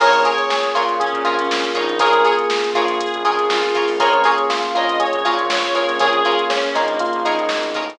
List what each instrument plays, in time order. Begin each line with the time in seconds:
0.00 synth bass 1 A#1, pad 5 (bowed) A#3 C#4 F4 G#4, electric piano 1 A#3 C#4 F4 G#4 A#4, pizzicato strings F4 G#4 A#4 C#5, clarinet C#5, kick, crash
0.13 closed hi-hat
0.25 pizzicato strings F4 G#4 A#4 C#5, electric piano 1 G#4, closed hi-hat
0.38 clarinet C#5, closed hi-hat
0.50 electric piano 1 G#4, snare
0.63 closed hi-hat
0.75 synth bass 1 A#2, pizzicato strings F4 G#4 A#4 C#5, electric piano 1 F4, closed hi-hat
0.89 snare, closed hi-hat
0.99 pad 5 (bowed) A#3 C#4 G#4 A#4, clarinet C#4, electric piano 1 G#4, kick, closed hi-hat
1.13 synth bass 1 A#2, kick, closed hi-hat
1.25 synth bass 1 A#1, electric piano 1 F4, pizzicato strings F4 G#4 A#4 C#5, closed hi-hat
1.38 synth bass 1 A#1, clarinet C#4, closed hi-hat
1.51 snare
1.65 closed hi-hat
1.75 synth bass 1 A#1, clarinet D#4, pizzicato strings F4 G#4 A#4 C#5, kick, closed hi-hat
1.89 closed hi-hat
1.99 electric piano 1 A#3 C#4 F4 G#4 A#4, pad 5 (bowed) A#3 C#4 F4 G#4, pizzicato strings F4 G#4 A#4 C#5, clarinet G#4, kick, closed hi-hat
2.13 snare, closed hi-hat
2.25 pizzicato strings F4 G#4 A#4 C#5, electric piano 1 G#4, closed hi-hat
2.39 closed hi-hat
2.50 snare
2.64 closed hi-hat
2.74 synth bass 1 A#1, pizzicato strings F4 G#4 A#4 C#5, electric piano 1 F4, clarinet G#4, kick, closed hi-hat
2.88 closed hi-hat
2.99 pad 5 (bowed) A#3 C#4 G#4 A#4, clarinet G#4, kick, closed hi-hat
3.14 synth bass 1 A#1, closed hi-hat
3.25 synth bass 1 A#1, pizzicato strings F4 G#4 A#4 C#5, electric piano 1 G#4, closed hi-hat
3.38 synth bass 1 A#1, snare, closed hi-hat
3.49 clarinet F4, snare
3.63 closed hi-hat
3.75 pizzicato strings F4 G#4 A#4 C#5, kick, closed hi-hat
3.88 synth bass 1 A#1, open hi-hat
3.99 synth bass 1 A#1, pad 5 (bowed) A#3 C#4 F4 G#4, electric piano 1 A#3 C#4 F4 G#4 A#4, pizzicato strings F4 G#4 A#4 C#5, clarinet C#5, kick, closed hi-hat
4.13 closed hi-hat
4.24 pizzicato strings F4 G#4 A#4 C#5, electric piano 1 G#4, closed hi-hat
4.38 closed hi-hat
4.50 electric piano 1 F4, snare
4.63 snare, closed hi-hat
4.75 synth bass 1 A#1, electric piano 1 F4, pizzicato strings F4 G#4 A#4 C#5, clarinet D#5, closed hi-hat
4.89 closed hi-hat
4.99 electric piano 1 G#4, clarinet C#5, kick, closed hi-hat
5.13 synth bass 1 A#1, kick, closed hi-hat
5.25 synth bass 1 A#2, pizzicato strings F4 G#4 A#4 C#5, electric piano 1 F4, closed hi-hat
5.39 synth bass 1 A#1, closed hi-hat
5.50 clarinet C#5, snare
5.63 closed hi-hat
5.75 electric piano 1 A#3 C#4 F4 G#4, pizzicato strings F4 G#4 A#4 C#5, closed hi-hat
5.89 synth bass 1 A#1, snare, closed hi-hat
5.99 synth bass 1 A#1, pizzicato strings F4 G#4 A#4 C#5, clarinet G#4, electric piano 1 G#4, kick, closed hi-hat
6.13 closed hi-hat
6.23 pizzicato strings F4 G#4 A#4 C#5, electric piano 1 F4, clarinet G#4, closed hi-hat
6.39 closed hi-hat
6.50 electric piano 1 C#4, clarinet C#4, snare
6.64 closed hi-hat
6.73 synth bass 1 A#1, clarinet A#3, electric piano 1 D#4, pizzicato strings F4 G#4 A#4 C#5, kick, snare, closed hi-hat
6.88 closed hi-hat
6.99 electric piano 1 F4, kick, closed hi-hat
7.13 synth bass 1 A#1, closed hi-hat
7.25 synth bass 1 A#1, electric piano 1 D#4, pizzicato strings F4 G#4 A#4 C#5, closed hi-hat
7.39 synth bass 1 A#1, closed hi-hat
7.49 synth bass 1 G#1, snare
7.63 closed hi-hat
7.74 synth bass 1 A1, pizzicato strings F4 G#4 A#4 C#5, kick, closed hi-hat
7.90 closed hi-hat